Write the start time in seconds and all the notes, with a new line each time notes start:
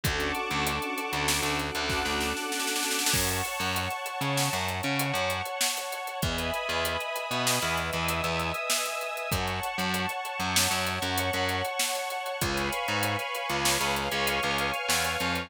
0.03 D2 C#4 D4 F#4 A4 F#5 A5 C#6 D6, kick, closed hi-hat
0.20 closed hi-hat
0.35 closed hi-hat
0.51 D2, closed hi-hat
0.67 closed hi-hat
0.82 closed hi-hat
0.98 closed hi-hat
1.13 D2, closed hi-hat
1.28 snare
1.43 D2, closed hi-hat
1.59 F#5 A5 D6 F#6, closed hi-hat
1.75 D2, closed hi-hat
1.90 kick, snare
2.05 D2, snare
2.21 snare
2.37 snare
2.52 snare
2.60 snare
2.67 snare
2.76 snare
2.83 snare
2.91 snare
2.99 snare
3.06 snare
3.13 F#2 C#5 F#5 A5 C#6, kick, crash
3.29 closed hi-hat
3.45 closed hi-hat
3.60 F#2, closed hi-hat
3.76 closed hi-hat
3.90 closed hi-hat
4.06 closed hi-hat
4.21 C#3, closed hi-hat
4.37 snare
4.53 F#2, closed hi-hat
4.68 C#5 F#5 C#6, closed hi-hat
4.83 C#3, closed hi-hat
4.99 closed hi-hat
5.14 F#2, closed hi-hat
5.30 closed hi-hat
5.45 closed hi-hat
5.61 snare
5.77 closed hi-hat
5.92 closed hi-hat
6.07 closed hi-hat
6.22 E2 B4 D#5 E5 G#5 B5 D#6, kick, closed hi-hat
6.38 closed hi-hat
6.54 closed hi-hat
6.69 E2, closed hi-hat
6.85 closed hi-hat
7.00 closed hi-hat
7.16 closed hi-hat
7.31 B2, closed hi-hat
7.47 snare
7.62 E2, closed hi-hat
7.77 E5 G#5 D#6 E6, closed hi-hat
7.93 E2, closed hi-hat
8.08 closed hi-hat
8.24 E2, closed hi-hat
8.39 closed hi-hat
8.54 closed hi-hat
8.70 snare
8.85 closed hi-hat
9.01 closed hi-hat
9.17 closed hi-hat
9.32 F#2 C#5 F#5 A5 C#6, kick, closed hi-hat
9.48 closed hi-hat
9.63 closed hi-hat
9.78 F#2, closed hi-hat
9.94 closed hi-hat
10.09 closed hi-hat
10.25 closed hi-hat
10.40 F#2, closed hi-hat
10.56 snare
10.71 F#2, closed hi-hat
10.86 C#5 F#5 C#6, closed hi-hat
11.02 F#2, closed hi-hat
11.18 closed hi-hat
11.33 F#2, closed hi-hat
11.49 closed hi-hat
11.65 closed hi-hat
11.79 snare
11.95 closed hi-hat
12.10 closed hi-hat
12.26 closed hi-hat
12.41 C#2 B4 C#5 F5 G#5 B5 C#6, kick, closed hi-hat
12.57 closed hi-hat
12.73 closed hi-hat
12.88 G#2, closed hi-hat
13.03 closed hi-hat
13.19 closed hi-hat
13.35 closed hi-hat
13.49 C#2, closed hi-hat
13.65 snare
13.80 C#2, closed hi-hat
13.96 F5 G#5 C#6 F6, closed hi-hat
14.11 C#2, closed hi-hat
14.27 closed hi-hat
14.43 C#2, closed hi-hat
14.58 closed hi-hat
14.74 closed hi-hat
14.89 E2, snare
15.04 closed hi-hat
15.20 F2, closed hi-hat
15.35 closed hi-hat